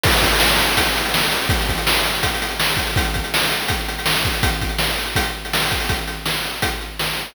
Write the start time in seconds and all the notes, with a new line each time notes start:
0.04 kick, crash
0.12 closed hi-hat
0.22 kick, closed hi-hat
0.32 closed hi-hat
0.40 snare
0.49 closed hi-hat
0.59 closed hi-hat
0.68 closed hi-hat
0.77 kick, closed hi-hat
0.85 closed hi-hat
0.96 closed hi-hat
1.05 closed hi-hat
1.14 snare
1.23 closed hi-hat
1.32 closed hi-hat
1.41 closed hi-hat
1.49 kick, closed hi-hat
1.61 closed hi-hat
1.69 kick, closed hi-hat
1.78 closed hi-hat
1.87 snare
1.97 closed hi-hat
2.05 closed hi-hat
2.14 closed hi-hat
2.23 kick, closed hi-hat
2.34 closed hi-hat
2.42 closed hi-hat
2.50 closed hi-hat
2.60 snare
2.69 closed hi-hat
2.77 kick, closed hi-hat
2.86 closed hi-hat
2.96 kick, closed hi-hat
3.05 closed hi-hat
3.14 kick, closed hi-hat
3.24 closed hi-hat
3.34 snare
3.44 closed hi-hat
3.51 closed hi-hat
3.62 closed hi-hat
3.68 kick, closed hi-hat
3.79 closed hi-hat
3.88 closed hi-hat
3.99 closed hi-hat
4.06 snare
4.15 closed hi-hat
4.25 kick, closed hi-hat
4.34 closed hi-hat
4.43 kick, closed hi-hat
4.54 closed hi-hat
4.61 kick, closed hi-hat
4.69 closed hi-hat
4.79 snare
4.89 closed hi-hat
4.98 closed hi-hat
5.06 closed hi-hat
5.16 kick, closed hi-hat
5.24 closed hi-hat
5.45 closed hi-hat
5.53 snare
5.62 closed hi-hat
5.70 kick, closed hi-hat
5.80 open hi-hat
5.89 kick, closed hi-hat
6.07 closed hi-hat
6.26 snare
6.45 closed hi-hat
6.62 kick, closed hi-hat
6.81 closed hi-hat
6.99 snare
7.17 closed hi-hat